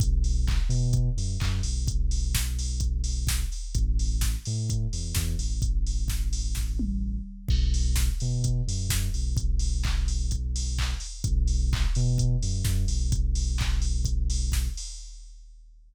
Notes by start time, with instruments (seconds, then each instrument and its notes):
0.00 synth bass 2 B1, kick, closed hi-hat
0.24 open hi-hat
0.47 kick, clap
0.69 synth bass 2 B2, open hi-hat
0.93 kick, closed hi-hat
1.17 synth bass 2 F#2, open hi-hat
1.40 synth bass 2 F#2, kick, clap
1.63 synth bass 2 B1, open hi-hat
1.88 kick, closed hi-hat
2.11 open hi-hat
2.35 kick, snare
2.59 open hi-hat
2.80 kick, closed hi-hat
3.04 open hi-hat
3.27 kick, snare
3.52 open hi-hat
3.75 synth bass 2 A1, kick, closed hi-hat
3.99 open hi-hat
4.21 kick, snare
4.46 synth bass 2 A2, open hi-hat
4.70 kick, closed hi-hat
4.93 synth bass 2 E2, open hi-hat
5.15 synth bass 2 E2, kick, snare
5.39 synth bass 2 A1, open hi-hat
5.62 kick, closed hi-hat
5.87 open hi-hat
6.08 kick, snare
6.33 open hi-hat
6.55 kick, snare
6.79 high tom
7.48 synth bass 2 B1, kick, crash
7.74 open hi-hat
7.96 kick, snare
8.20 synth bass 2 B2, open hi-hat
8.44 kick, closed hi-hat
8.68 synth bass 2 F#2, open hi-hat
8.89 synth bass 2 F#2, kick, snare
9.14 synth bass 2 B1, open hi-hat
9.37 kick, closed hi-hat
9.59 open hi-hat
9.83 kick, clap
10.08 open hi-hat
10.31 kick, closed hi-hat
10.56 open hi-hat
10.79 kick, clap
11.00 open hi-hat
11.24 synth bass 2 B1, kick, closed hi-hat
11.48 open hi-hat
11.73 kick, clap
11.95 synth bass 2 B2, open hi-hat
12.18 kick, closed hi-hat
12.42 synth bass 2 F#2, open hi-hat
12.65 synth bass 2 F#2, kick, snare
12.88 synth bass 2 B1, open hi-hat
13.12 kick, closed hi-hat
13.35 open hi-hat
13.58 kick, clap
13.82 open hi-hat
14.05 kick, closed hi-hat
14.30 open hi-hat
14.52 kick, snare
14.77 open hi-hat